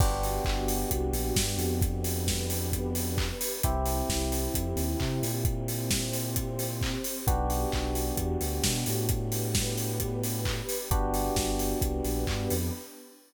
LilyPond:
<<
  \new Staff \with { instrumentName = "Electric Piano 1" } { \time 4/4 \key g \major \tempo 4 = 132 <b d' fis' g'>1~ | <b d' fis' g'>1 | <c' e' g'>1~ | <c' e' g'>1 |
<b d' fis' g'>1~ | <b d' fis' g'>1 | <b d' fis' g'>1 | }
  \new Staff \with { instrumentName = "Synth Bass 2" } { \clef bass \time 4/4 \key g \major g,,4 g,,4 c,8 ais,,8 g,8 f,8~ | f,1 | c,4 c,4 f,8 dis,8 c8 ais,8~ | ais,1 |
b,,4 b,,4 e,8 d,8 b,8 a,8~ | a,1 | g,,4 g,,4 c,8 ais,,8 g,8 f,8 | }
  \new Staff \with { instrumentName = "Pad 2 (warm)" } { \time 4/4 \key g \major <b d' fis' g'>1 | <b d' g' b'>1 | <c' e' g'>1 | <c' g' c''>1 |
<b d' fis' g'>1 | <b d' g' b'>1 | <b d' fis' g'>2 <b d' g' b'>2 | }
  \new DrumStaff \with { instrumentName = "Drums" } \drummode { \time 4/4 <cymc bd>8 hho8 <hc bd>8 hho8 <hh bd>8 hho8 <bd sn>8 hho8 | <hh bd>8 hho8 <bd sn>8 hho8 <hh bd>8 hho8 <hc bd>8 hho8 | <hh bd>8 hho8 <bd sn>8 hho8 <hh bd>8 hho8 <hc bd>8 hho8 | <hh bd>8 hho8 <bd sn>8 hho8 <hh bd>8 hho8 <hc bd>8 hho8 |
<hh bd>8 hho8 <hc bd>8 hho8 <hh bd>8 hho8 <bd sn>8 hho8 | <hh bd>8 hho8 <bd sn>8 hho8 <hh bd>8 hho8 <hc bd>8 hho8 | <hh bd>8 hho8 <bd sn>8 hho8 <hh bd>8 hho8 <hc bd>8 hho8 | }
>>